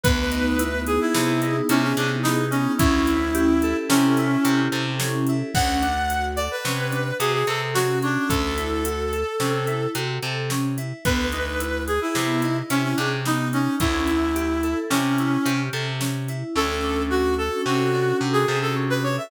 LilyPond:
<<
  \new Staff \with { instrumentName = "Clarinet" } { \time 5/4 \key d \lydian \tempo 4 = 109 b'4. gis'16 e'4~ e'16 cis'16 cis'16 d'16 r16 dis'8 cis'8 | e'2 cis'4. r4. | fis''4. d''16 b'4~ b'16 gis'16 gis'16 a'16 r16 fis'8 d'8 | a'2. r2 |
b'4. gis'16 e'4~ e'16 cis'16 cis'16 d'16 r16 dis'8 cis'8 | e'2 cis'4. r4. | a'4 fis'8 a'8 fis'4 r16 gis'8 a'16 r16 b'16 cis''16 e''16 | }
  \new Staff \with { instrumentName = "Electric Piano 2" } { \time 5/4 \key d \lydian b8 dis'8 e'8 gis'8 b8 dis'8 e'8 gis'8 b8 dis'8 | cis'8 e'8 g'8 a'8 cis'8 e'8 g'8 a'8 cis'8 e'8 | cis'8 d'8 fis'8 a'8 cis'8 d'8 fis'8 a'8 cis'8 cis'8~ | cis'8 e'8 fis'8 a'8 cis'8 e'8 fis'8 a'8 cis'8 e'8 |
b8 dis'8 e'8 gis'8 b8 dis'8 e'8 gis'8 b8 dis'8 | cis'8 e'8 g'8 a'8 cis'8 e'8 g'8 a'8 cis'8 e'8 | cis'8 d'8 fis'8 a'8 cis'8 d'8 fis'8 a'8 cis'8 d'8 | }
  \new Staff \with { instrumentName = "Electric Bass (finger)" } { \clef bass \time 5/4 \key d \lydian d,2 c4 c8 c4. | d,2 c4 c8 c4. | d,2 c4 c8 c4. | d,2 c4 c8 c4. |
d,2 c4 c8 c4. | d,2 c4 c8 c4. | d,2 c4 c8 c4. | }
  \new DrumStaff \with { instrumentName = "Drums" } \drummode { \time 5/4 <hh bd>8 hh8 hh8 hh8 sn8 hh8 hh8 hh8 sn8 hh8 | <hh bd>8 hh8 hh8 hh8 sn8 hh8 hh8 hh8 sn8 hh8 | <cymc bd>8 hh8 hh8 hh8 sn8 hh8 hh8 hh8 sn8 hh8 | <hh bd>8 hh8 hh8 hh8 sn8 hh8 hh8 hh8 sn8 hh8 |
<hh bd>8 hh8 hh8 hh8 sn8 hh8 hh8 hh8 sn8 hh8 | <hh bd>8 hh8 hh8 hh8 sn8 hh8 hh8 hh8 sn8 hh8 | r4 r4 r4 r4 r4 | }
>>